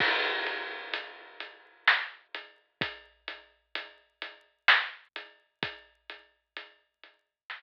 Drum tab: CC |x-----|------|------|
HH |-xxx-x|xxxx-x|xxxx--|
SD |----o-|----o-|----o-|
BD |o-----|o-----|o-----|